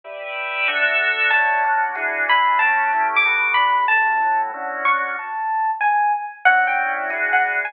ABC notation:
X:1
M:4/4
L:1/8
Q:"Swing" 1/4=187
K:D
V:1 name="Electric Piano 1"
z8 | a3 z3 b2 | a3 d'3 b2 | a3 z3 c'2 |
a3 z ^g2 z2 | f g2 z2 f z ^g |]
V:2 name="Drawbar Organ"
[GBde]4 [DFAe]4 | [D,CEF]2 [D,CDF]2 [E,DF^G]2 [E,DEG]2 | [A,CFG]2 [A,CEG]2 [G,A,B,F]2 [G,A,DF]2 | [A,,G,CF]2 [A,,G,EF]2 [D,CEF]2 [D,CDF]2 |
z8 | [D,CEF]4 [E,DF^G]4 |]